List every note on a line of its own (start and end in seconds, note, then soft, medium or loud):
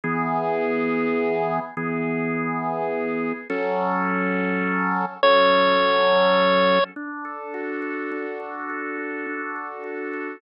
0.04 1.59 E3 loud
0.04 1.59 B3 loud
0.04 1.59 G#4 loud
1.77 3.33 E3 medium
1.77 3.33 B3 loud
1.77 3.33 G#4 loud
3.50 5.05 F#3 loud
3.50 5.05 C#4 loud
3.50 5.05 A4 loud
5.23 6.79 F#3 loud
5.23 6.79 C#4 loud
5.23 6.79 A4 medium
5.23 6.84 C#5 medium
6.96 8.11 D4 medium
7.25 7.82 A4 medium
7.54 8.98 F#4 medium
7.82 8.39 A4 medium
8.12 9.26 D4 medium
8.40 8.69 A4 medium
8.69 9.55 A4 medium
8.98 9.83 F#4 medium
9.27 10.36 D4 medium
9.56 10.13 A4 medium
9.84 10.39 F#4 medium
10.13 10.41 A4 medium